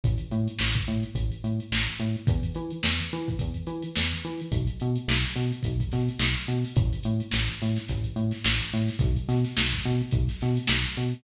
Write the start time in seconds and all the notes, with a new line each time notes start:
0.04 A1, kick, closed hi-hat
0.18 closed hi-hat
0.31 A2, closed hi-hat
0.48 closed hi-hat
0.59 A1, snare
0.75 kick, closed hi-hat
0.87 A2, closed hi-hat
1.03 closed hi-hat
1.15 A1, kick, closed hi-hat
1.32 closed hi-hat
1.44 A2, closed hi-hat
1.60 closed hi-hat
1.72 A1, snare
1.87 closed hi-hat
2.00 A2, closed hi-hat
2.16 closed hi-hat
2.27 E2, kick, closed hi-hat
2.43 closed hi-hat
2.55 E3, closed hi-hat
2.70 closed hi-hat
2.83 E2, snare
2.99 closed hi-hat
3.11 E3, closed hi-hat
3.28 kick, closed hi-hat
3.39 E2, kick, closed hi-hat
3.54 closed hi-hat
3.67 E3, closed hi-hat
3.82 closed hi-hat
3.96 E2, snare
4.12 closed hi-hat
4.24 E3, closed hi-hat
4.40 closed hi-hat
4.52 B1, kick, closed hi-hat
4.67 closed hi-hat
4.80 B2, closed hi-hat
4.96 closed hi-hat
5.08 B1, snare
5.23 closed hi-hat
5.36 B2, closed hi-hat
5.52 closed hi-hat
5.63 B1, kick, closed hi-hat
5.80 kick, closed hi-hat
5.92 B2, snare, closed hi-hat
6.09 closed hi-hat
6.19 B1, snare
6.35 closed hi-hat
6.48 B2, closed hi-hat
6.64 open hi-hat
6.76 A1, kick, closed hi-hat
6.93 closed hi-hat
7.03 A2, closed hi-hat
7.20 closed hi-hat
7.31 A1, snare
7.49 closed hi-hat
7.60 A2, snare, closed hi-hat
7.76 snare, closed hi-hat
7.88 A1, kick, closed hi-hat
8.04 closed hi-hat
8.16 A2, closed hi-hat
8.31 snare, closed hi-hat
8.44 A1, snare
8.59 closed hi-hat
8.71 A2, snare, closed hi-hat
8.88 snare, closed hi-hat
8.99 B1, kick, closed hi-hat
9.16 closed hi-hat
9.28 B2, snare, closed hi-hat
9.44 snare, closed hi-hat
9.57 B1, snare
9.73 kick, closed hi-hat
9.84 B2, closed hi-hat
10.00 closed hi-hat
10.11 B1, kick, closed hi-hat
10.28 snare, closed hi-hat
10.41 B2, snare, closed hi-hat
10.57 closed hi-hat
10.67 B1, snare
10.83 closed hi-hat
10.97 B2, closed hi-hat
11.12 closed hi-hat